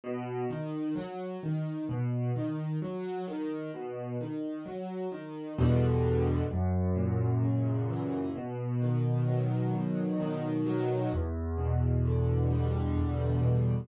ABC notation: X:1
M:3/4
L:1/8
Q:1/4=65
K:E
V:1 name="Acoustic Grand Piano" clef=bass
B,, D, F, D, B,, D, | F, D, B,, D, F, D, | [K:Em] [E,,B,,D,G,]2 F,, ^A,, ^C, E, | B,, ^D, F, B,, D, F, |
E,, B,, D, G, E,, B,, |]